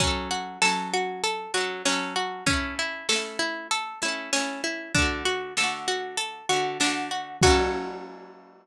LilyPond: <<
  \new Staff \with { instrumentName = "Pizzicato Strings" } { \time 4/4 \key fis \minor \tempo 4 = 97 cis'8 fis'8 a'8 fis'8 a'8 fis'8 cis'8 fis'8 | cis'8 e'8 a'8 e'8 a'8 e'8 cis'8 e'8 | d'8 fis'8 a'8 fis'8 a'8 fis'8 d'8 fis'8 | fis'1 | }
  \new Staff \with { instrumentName = "Orchestral Harp" } { \time 4/4 \key fis \minor <fis cis' a'>4 <fis cis' a'>4. <fis cis' a'>8 <fis cis' a'>4 | <a cis' e'>4 <a cis' e'>4. <a cis' e'>8 <a cis' e'>4 | <d a fis'>4 <d a fis'>4. <d a fis'>8 <d a fis'>4 | <fis cis' a'>1 | }
  \new DrumStaff \with { instrumentName = "Drums" } \drummode { \time 4/4 <hh bd>4 sn4 hh4 sn4 | <hh bd>4 sn4 hh4 sn4 | <hh bd>4 sn4 hh4 sn4 | <cymc bd>4 r4 r4 r4 | }
>>